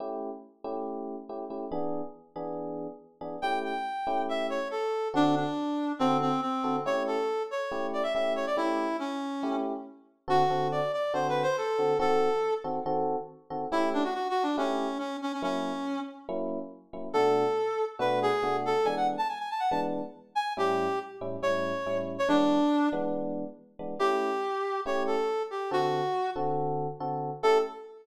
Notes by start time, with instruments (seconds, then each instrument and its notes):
0.00 electric piano 1 A3 C#4 E4 G4
0.64 electric piano 1 A3 C#4 E4 G4
1.29 electric piano 1 A3 C#4 E4 G4
1.50 electric piano 1 A3 C#4 E4 G4
1.72 electric piano 1 E3 B3 D4 G#4
2.36 electric piano 1 E3 B3 D4 G#4
3.21 electric piano 1 E3 B3 D4 G#4
3.42 electric piano 1 A3 C#4 E4 G4, clarinet G5
3.64 clarinet G5
4.07 electric piano 1 A3 C#4 E4 G4
4.29 clarinet E5
4.50 clarinet C#5
4.71 clarinet A4
5.14 electric piano 1 D3 C4 F#4 A4, clarinet D4
5.36 clarinet D4
5.99 electric piano 1 D3 C4 F#4 A4, clarinet C4
6.21 clarinet C4
6.42 clarinet C4
6.64 electric piano 1 D3 C4 F#4 A4
6.86 electric piano 1 A3 C#4 E4 G4, clarinet C#5
7.07 clarinet A4
7.51 clarinet C#5
7.72 electric piano 1 A3 C#4 E4 G4
7.93 clarinet D5
8.03 clarinet E5
8.14 electric piano 1 A3 C#4 E4 G4, clarinet E5
8.36 clarinet C#5
8.47 clarinet D5
8.57 electric piano 1 A3 C#4 E4 G4, clarinet E4
8.99 clarinet C#4
9.43 electric piano 1 A3 C#4 E4 G4
10.28 electric piano 1 D3 C4 F#4 A4, clarinet F#4
10.50 electric piano 1 D3 C4 F#4 A4
10.72 clarinet D5
10.93 clarinet D5
11.14 electric piano 1 D3 C4 F#4 A4, clarinet C5
11.29 clarinet B4
11.43 clarinet C5
11.58 clarinet A4
11.78 electric piano 1 D3 C4 F#4 A4
11.99 electric piano 1 D#3 C4 F#4 A4, clarinet A4
12.64 electric piano 1 D#3 C4 F#4 A4
12.86 electric piano 1 D#3 C4 F#4 A4
13.50 electric piano 1 D#3 C4 F#4 A4
13.72 electric piano 1 A3 C#4 E4 G4, clarinet E4
13.93 clarinet D4
14.04 clarinet F#4
14.14 clarinet F#4
14.30 clarinet F#4
14.43 clarinet D4
14.57 electric piano 1 A3 C#4 E4 G4, clarinet C#4
14.99 clarinet C#4
15.22 clarinet C#4
15.33 clarinet C#4
15.42 electric piano 1 F#3 A#3 C#4 E4, clarinet C#4
16.29 electric piano 1 F#3 A#3 C#4 E4
16.93 electric piano 1 F#3 A#3 C#4 E4
17.13 electric piano 1 B2 A3 D4 F#4, clarinet A4
17.99 electric piano 1 B2 A3 D4 F#4, clarinet B4
18.22 clarinet G#4
18.43 electric piano 1 B2 A3 D4 F#4
18.65 clarinet A4
18.85 electric piano 1 E3 G#3 B3 D4, clarinet G#5
18.97 clarinet F#5
19.17 clarinet A5
19.29 clarinet G#5
19.39 clarinet G#5
19.50 clarinet A5
19.60 clarinet F#5
19.70 electric piano 1 E3 G#3 B3 D4, clarinet A5
20.35 clarinet G#5
20.57 electric piano 1 A2 G3 C#4 E4, clarinet G4
21.21 electric piano 1 A2 G3 C#4 E4
21.42 electric piano 1 A2 G3 C#4 E4, clarinet C#5
21.86 electric piano 1 A2 G3 C#4 E4
22.18 clarinet C#5
22.28 electric piano 1 E3 G#3 B3 D4, clarinet D4
22.92 electric piano 1 E3 G#3 B3 D4
23.79 electric piano 1 E3 G#3 B3 D4
23.99 electric piano 1 A3 C#4 E4 G4, clarinet G4
24.86 electric piano 1 A3 C#4 E4 G4, clarinet C#5
25.07 clarinet A4
25.51 clarinet G4
25.71 electric piano 1 D3 C4 F#4 A4, clarinet F#4
26.36 electric piano 1 D3 C4 F#4 A4
27.00 electric piano 1 D3 C4 F#4 A4
27.43 electric piano 1 A3 C#4 E4 G4, clarinet A4